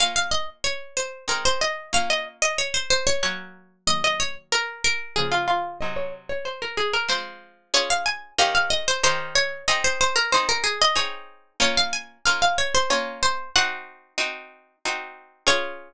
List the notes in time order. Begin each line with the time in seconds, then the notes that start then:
0.00 A#3 C#4 F4 F5
0.16 F5
0.31 D#5
0.64 C#5
0.97 C5
1.28 G#3 C4 D#4 A#4
1.45 C5
1.61 D#5
1.93 A#3 C#4 F4 F5
2.10 D#5
2.42 D#5
2.58 C#5
2.74 C5
2.90 C5
3.07 C#5
3.23 F#3 A#3 C#4 C#5
3.87 D#3 F#3 A#3 D#5
4.04 D#5
4.20 C#5
4.52 A#4
4.84 A#4
5.16 C#3 F3 A#3 G#4
5.32 F4
5.48 F4
5.81 C3 F#3 D#4 D#5
5.96 C#5
6.29 C#5
6.45 C5
6.62 A#4
6.77 G#4
6.93 A#4
7.08 F3 G#3 C4 C5
7.74 C#4 F4 G#4 C#5
7.90 F5
8.06 G#5
8.38 D#3 C#4 G4 A#4 F5
8.55 F5
8.70 D#5
8.88 C5
9.03 D#3 C#4 G4 A#4 C5
9.35 C#5
9.68 C4 D#4 G#4 D#5
9.84 C5
10.01 C5
10.16 A#4
10.32 C4 D#4 G#4 C5
10.49 A#4
10.64 G#4
10.82 D#5
10.96 C4 D#4 G#4 C#5
11.60 A#3 C#4 F4 C#5
11.77 F5
11.93 G#5
12.26 A#3 C#4 F4 F5
12.42 F5
12.58 C#5
12.75 C5
12.90 A#3 C#4 F4 C#5
13.23 C5
13.56 C4 D#4 F#4 F#5
14.18 C4 D#4 F#4
14.85 C4 D#4 F#4
15.47 C#4 F4 G#4 C#5